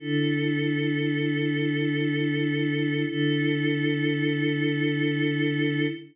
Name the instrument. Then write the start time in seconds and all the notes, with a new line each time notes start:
choir aahs
0.00 D3 E4 A4
3.08 D3 E4 A4